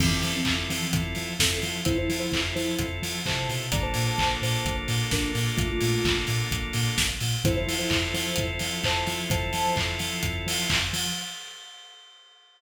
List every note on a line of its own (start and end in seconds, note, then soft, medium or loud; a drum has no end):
0.00 0.13 F2 medium
0.00 0.10 E3 medium
0.00 0.10 C4 medium
0.00 0.41 C4 medium
0.00 0.41 E4 medium
0.00 0.41 F4 medium
0.00 0.41 A4 medium
0.00 kick loud
0.00 crash loud
0.12 0.33 E3 medium
0.12 0.33 C4 medium
0.23 0.36 F3 medium
0.23 open hi-hat medium
0.35 0.54 E3 medium
0.35 0.54 C4 medium
0.45 0.59 F2 medium
0.45 0.87 C4 medium
0.45 0.87 E4 medium
0.45 0.87 F4 medium
0.45 0.87 A4 medium
0.45 kick medium
0.45 clap loud
0.70 1.01 E3 medium
0.70 0.83 F3 medium
0.70 1.01 C4 medium
0.70 open hi-hat medium
0.92 1.06 F2 medium
0.92 1.34 C4 medium
0.92 1.34 E4 medium
0.92 1.34 F4 medium
0.92 1.34 A4 medium
0.92 kick loud
0.92 closed hi-hat loud
1.15 1.29 F3 medium
1.15 open hi-hat medium
1.39 1.52 F2 medium
1.39 1.81 C4 medium
1.39 1.59 C4 medium
1.39 1.81 E4 medium
1.39 1.81 F4 medium
1.39 1.81 A4 medium
1.39 1.59 A4 medium
1.39 kick medium
1.39 snare loud
1.62 1.76 F3 medium
1.62 open hi-hat medium
1.85 1.99 F2 medium
1.85 2.28 C4 medium
1.85 1.96 E4 medium
1.85 2.28 E4 medium
1.85 2.28 F4 medium
1.85 2.28 A4 medium
1.85 1.96 C5 medium
1.85 kick loud
1.85 closed hi-hat loud
1.97 2.19 E4 medium
1.97 2.19 C5 medium
2.09 2.22 F3 medium
2.09 open hi-hat medium
2.19 2.40 E4 medium
2.19 2.40 C5 medium
2.32 2.45 F2 medium
2.32 2.75 C4 medium
2.32 2.75 E4 medium
2.32 2.75 F4 medium
2.32 2.75 A4 medium
2.32 kick medium
2.32 clap loud
2.55 2.69 F3 medium
2.55 2.86 E4 medium
2.55 2.86 C5 medium
2.55 open hi-hat medium
2.79 2.92 F2 medium
2.79 3.21 C4 medium
2.79 3.21 E4 medium
2.79 3.21 F4 medium
2.79 3.21 A4 medium
2.79 kick medium
2.79 closed hi-hat loud
3.02 3.15 F3 medium
3.02 open hi-hat medium
3.25 3.46 C3 medium
3.25 3.67 C4 medium
3.25 3.67 E4 medium
3.25 3.67 F4 medium
3.25 3.67 A4 medium
3.25 3.49 C5 medium
3.25 3.49 A5 medium
3.25 kick medium
3.25 clap loud
3.49 3.70 B2 medium
3.49 open hi-hat medium
3.71 3.85 A#1 medium
3.71 7.06 A#3 medium
3.71 7.06 D4 medium
3.71 7.06 F4 medium
3.71 7.06 A4 medium
3.71 3.83 D5 medium
3.71 3.83 A#5 medium
3.71 kick loud
3.71 closed hi-hat loud
3.82 4.04 C5 medium
3.82 4.04 A5 medium
3.94 4.08 A#2 medium
3.94 open hi-hat medium
4.07 4.29 C5 medium
4.07 4.29 A5 medium
4.18 4.31 A#1 medium
4.18 kick medium
4.18 clap loud
4.42 4.55 A#2 medium
4.42 4.76 C5 medium
4.42 4.76 A5 medium
4.42 open hi-hat medium
4.65 4.78 A#1 medium
4.65 kick medium
4.65 closed hi-hat medium
4.88 5.01 A#2 medium
4.88 open hi-hat medium
5.11 5.25 A#1 medium
5.11 5.32 D4 medium
5.11 5.32 A#4 medium
5.11 kick medium
5.11 snare loud
5.35 5.48 A#2 medium
5.35 open hi-hat medium
5.57 5.71 A#1 medium
5.57 5.68 A3 medium
5.57 5.68 F4 medium
5.57 kick loud
5.57 closed hi-hat loud
5.71 6.17 A3 medium
5.71 6.17 F4 medium
5.81 5.94 A#2 medium
5.81 open hi-hat medium
6.05 6.17 A#1 medium
6.05 kick loud
6.05 clap loud
6.27 6.41 A#2 medium
6.27 open hi-hat medium
6.51 6.64 A#1 medium
6.51 kick medium
6.51 closed hi-hat loud
6.73 6.87 A#2 medium
6.73 open hi-hat medium
6.98 7.11 A#1 medium
6.98 kick medium
6.98 snare loud
7.20 7.34 A#2 medium
7.20 open hi-hat medium
7.44 7.57 F2 loud
7.44 10.80 C4 medium
7.44 10.80 E4 medium
7.44 7.56 E4 medium
7.44 10.80 F4 medium
7.44 10.80 A4 medium
7.44 7.56 C5 medium
7.44 kick loud
7.44 closed hi-hat loud
7.56 7.75 E4 medium
7.56 7.75 C5 medium
7.67 7.80 F3 medium
7.67 open hi-hat medium
7.78 7.99 E4 medium
7.78 7.99 C5 medium
7.90 8.03 F2 medium
7.90 kick medium
7.90 clap loud
8.13 8.27 F3 medium
8.13 8.46 E4 medium
8.13 8.46 C5 medium
8.13 open hi-hat medium
8.36 8.50 F2 medium
8.36 kick medium
8.36 closed hi-hat loud
8.59 8.73 F3 medium
8.59 open hi-hat medium
8.84 8.97 F2 medium
8.84 9.05 C5 medium
8.84 9.05 A5 medium
8.84 kick medium
8.84 clap loud
9.07 9.20 F3 medium
9.07 open hi-hat medium
9.30 9.43 F2 medium
9.30 9.74 C5 medium
9.30 9.74 A5 medium
9.30 kick loud
9.30 closed hi-hat loud
9.53 9.66 F3 medium
9.53 open hi-hat medium
9.76 9.90 F2 medium
9.76 kick medium
9.76 clap loud
9.99 10.13 F3 medium
9.99 open hi-hat medium
10.23 10.36 F2 medium
10.23 kick medium
10.23 closed hi-hat loud
10.47 10.59 F3 medium
10.47 open hi-hat loud
10.70 10.83 F2 medium
10.70 kick medium
10.70 clap loud
10.93 11.06 F3 medium
10.93 open hi-hat medium